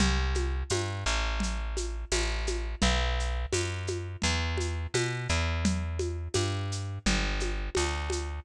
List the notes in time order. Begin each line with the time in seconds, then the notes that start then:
0.00 C2, low conga, shaker
0.35 high conga, shaker
0.70 G2, tambourine, high conga, shaker
1.06 A1, shaker
1.40 low conga, shaker
1.77 high conga, shaker
2.12 A1, tambourine, high conga, shaker
2.47 high conga, shaker
2.82 B1, low conga, shaker
3.20 shaker
3.52 F#2, tambourine, high conga, shaker
3.87 high conga, shaker
4.22 E2, low conga, shaker
4.57 high conga, shaker
4.94 B2, tambourine, high conga, shaker
5.29 E2, shaker
5.65 low conga, shaker
5.99 high conga, shaker
6.34 G2, tambourine, high conga, shaker
6.72 shaker
7.06 G1, low conga, shaker
7.40 high conga, shaker
7.75 D2, tambourine, high conga, shaker
8.10 high conga, shaker